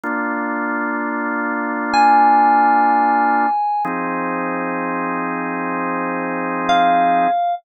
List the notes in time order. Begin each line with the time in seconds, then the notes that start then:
0.03 A#3 D4 F4
1.93 G#5
3.85 F3 C4 D#4 G#4
6.69 F5